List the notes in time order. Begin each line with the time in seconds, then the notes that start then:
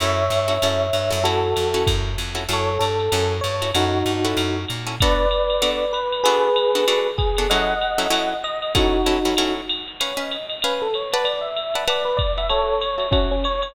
0.00 F#2 C#4 E4 F#4 A4 C#5 E5, ride
0.30 G2, hi-hat pedal, ride
0.48 C#4 E4 F#4 A4, ride
0.62 F#2 C#4 E4 F#4 A4, ride
0.93 G2, hi-hat pedal, ride
1.10 F#2 C#4 E4 F#4 A4, ride
1.24 C#4 E4 F#4 A4, ride
1.56 F2, hi-hat pedal, ride
1.74 C#4 E4 F#4 A4, ride
1.87 F#2, kick, ride
2.18 F2, hi-hat pedal, ride
2.35 C#4 E4 F#4 A4, ride
2.49 F#2 C#4 E4 F#4 A4, ride
2.53 A4 C#5
2.79 G2 A4, hi-hat pedal, ride
2.99 ride
3.12 F#2 C#4 E4 F#4 A4, ride
3.41 G2 C#5, hi-hat pedal, ride
3.62 C#4 E4 F#4 A4, ride
3.74 F#2 C#4 D#4 E4 F#4 A4, ride
4.06 G2, hi-hat pedal, ride
4.25 C#4 E4 F#4 A4, ride
4.37 F#2, ride
4.68 A#2, hi-hat pedal, ride
4.87 C#4 E4 F#4 A4, ride
5.00 B3 D4 F#4 A4 B4 D5, kick, ride
5.31 hi-hat pedal, ride
5.50 ride
5.62 B3 D4 F#4 A4, ride
5.93 B4, hi-hat pedal, ride
6.12 ride
6.24 B3 D4 F#4 G#4 A4 B4, ride
6.56 hi-hat pedal, ride
6.75 B3 D4 F#4 A4, ride
6.88 B3 D4 F#4 A4, ride
7.18 G#4, kick, hi-hat pedal, ride
7.37 B3 D4 F#4 A4, ride
7.50 F#3 C#4 E4 A4 D#5 F#5, ride
7.81 hi-hat pedal, ride
7.98 F#3 C#4 E4 A4, ride
8.10 F#3 C#4 E4 A4, ride
8.43 D#5, hi-hat pedal, ride
8.62 ride
8.75 F#3 C#4 D#4 E4 F#4 A4, kick, ride
9.06 F#3 C#4 E4 A4, hi-hat pedal, ride
9.25 F#3 C#4 E4 A4, ride
9.37 F#3 C#4 E4 A4, ride
9.69 hi-hat pedal, ride
9.88 ride
10.00 C#4 B4 C#5 F5 G#5, ride
10.17 C#4 B4 D#5 F5 G#5
10.31 hi-hat pedal, ride
10.49 ride
10.62 C#4 B4 F5 G#5, ride
10.82 A4
10.93 C#5, hi-hat pedal, ride
11.12 B4 D5 F#5 A5, ride
11.24 D5, ride
11.41 E5
11.56 hi-hat pedal, ride
11.74 B4 D5 F#5 A5, ride
11.87 B4 D5 F#5 A5, ride
12.05 B4
12.17 D5, kick, hi-hat pedal, ride
12.38 B4 D5 E5 F#5 A5, ride
12.49 F#4 A4 C#5 E5 A5, ride
12.81 C#5, hi-hat pedal, ride
12.98 F#4 C#5 E5 A5, ride
13.11 C#4 F#4 C#5 E5 A5, kick, ride
13.31 C#4
13.44 C#5, hi-hat pedal, ride
13.62 C#5, ride